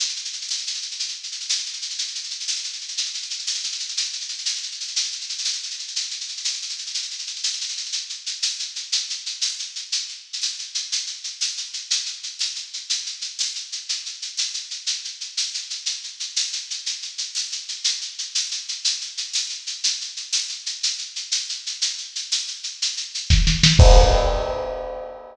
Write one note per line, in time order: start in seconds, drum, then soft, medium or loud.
0.00 shaker medium
0.09 shaker medium
0.16 shaker medium
0.25 shaker medium
0.33 shaker medium
0.41 shaker medium
0.49 tambourine medium
0.49 shaker medium
0.58 shaker medium
0.67 shaker medium
0.74 shaker medium
0.82 shaker medium
0.91 shaker medium
0.99 shaker medium
1.08 shaker medium
1.23 shaker medium
1.32 shaker medium
1.40 shaker medium
1.49 tambourine medium
1.49 shaker medium
1.58 shaker medium
1.66 shaker medium
1.73 shaker medium
1.82 shaker medium
1.90 shaker medium
1.98 shaker medium
2.08 shaker soft
2.15 shaker medium
2.24 shaker medium
2.30 shaker medium
2.40 shaker medium
2.48 tambourine medium
2.48 shaker medium
2.56 shaker medium
2.64 shaker medium
2.73 shaker medium
2.81 shaker soft
2.88 shaker medium
2.97 shaker medium
3.05 shaker medium
3.14 shaker medium
3.22 shaker medium
3.30 shaker medium
3.39 shaker medium
3.47 tambourine medium
3.47 shaker medium
3.54 shaker medium
3.63 shaker medium
3.72 shaker medium
3.80 shaker medium
3.89 shaker medium
3.97 shaker medium
4.05 shaker soft
4.13 shaker medium
4.21 shaker medium
4.29 shaker medium
4.38 shaker medium
4.45 tambourine medium
4.45 shaker medium
4.56 shaker medium
4.63 shaker medium
4.72 shaker medium
4.80 shaker medium
4.88 shaker medium
4.96 shaker medium
5.04 shaker medium
5.12 shaker medium
5.21 shaker medium
5.29 shaker medium
5.38 shaker medium
5.45 tambourine medium
5.45 shaker medium
5.53 shaker medium
5.63 shaker medium
5.71 shaker medium
5.79 shaker medium
5.88 shaker medium
5.96 shaker medium
6.03 shaker soft
6.11 shaker medium
6.21 shaker medium
6.28 shaker medium
6.37 shaker medium
6.44 tambourine medium
6.44 shaker medium
6.53 shaker medium
6.62 shaker medium
6.69 shaker medium
6.78 shaker medium
6.86 shaker medium
6.94 shaker medium
7.02 shaker medium
7.11 shaker medium
7.19 shaker medium
7.27 shaker medium
7.36 shaker medium
7.43 tambourine medium
7.43 shaker medium
7.53 shaker medium
7.61 shaker medium
7.69 shaker medium
7.77 shaker medium
7.85 shaker medium
7.92 shaker medium
8.09 shaker medium
8.26 shaker medium
8.42 tambourine medium
8.42 shaker medium
8.59 shaker medium
8.76 shaker medium
8.92 shaker medium
9.10 shaker medium
9.26 shaker medium
9.41 tambourine medium
9.41 shaker medium
9.59 shaker medium
9.76 shaker medium
9.92 shaker medium
10.09 shaker soft
10.33 shaker medium
10.42 tambourine medium
10.42 shaker medium
10.59 shaker medium
10.75 shaker medium
10.92 shaker medium
11.07 shaker medium
11.24 shaker medium
11.41 tambourine medium
11.41 shaker medium
11.57 shaker medium
11.73 shaker medium
11.90 shaker medium
12.06 shaker medium
12.23 shaker medium
12.39 tambourine medium
12.39 shaker medium
12.55 shaker medium
12.73 shaker medium
12.90 shaker medium
13.06 shaker medium
13.21 shaker medium
13.39 tambourine medium
13.39 shaker medium
13.55 shaker medium
13.72 shaker medium
13.89 shaker medium
14.06 shaker medium
14.22 shaker medium
14.37 tambourine medium
14.37 shaker medium
14.54 shaker medium
14.71 shaker medium
14.87 shaker medium
15.05 shaker medium
15.21 shaker medium
15.37 tambourine medium
15.37 shaker medium
15.54 shaker medium
15.70 shaker medium
15.86 shaker medium
16.04 shaker medium
16.20 shaker medium
16.36 tambourine medium
16.36 shaker medium
16.53 shaker medium
16.70 shaker medium
16.86 shaker medium
17.02 shaker medium
17.18 shaker medium
17.35 tambourine medium
17.35 shaker medium
17.52 shaker medium
17.68 shaker medium
17.84 shaker loud
18.01 shaker medium
18.18 shaker medium
18.35 tambourine medium
18.35 shaker medium
18.51 shaker medium
18.68 shaker medium
18.85 shaker medium
19.01 shaker medium
19.17 shaker medium
19.33 tambourine medium
19.33 shaker medium
19.49 shaker medium
19.67 shaker medium
19.84 shaker loud
20.01 shaker medium
20.17 shaker medium
20.33 tambourine medium
20.33 shaker medium
20.49 shaker medium
20.66 shaker medium
20.83 shaker medium
20.98 shaker medium
21.16 shaker medium
21.32 tambourine medium
21.32 shaker medium
21.49 shaker medium
21.66 shaker medium
21.82 shaker medium
21.98 shaker medium
22.15 shaker medium
22.32 tambourine medium
22.32 shaker medium
22.48 shaker medium
22.63 shaker medium
22.82 shaker medium
22.97 shaker medium
23.15 shaker medium
23.30 kick medium
23.30 snare medium
23.47 snare medium
23.63 snare medium
23.79 kick loud
23.79 crash loud